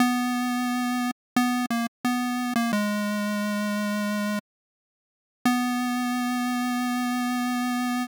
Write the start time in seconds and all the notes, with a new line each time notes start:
0.00 B3
1.36 B3
1.70 A#3
2.05 B3
2.56 A#3
2.73 G#3
5.45 B3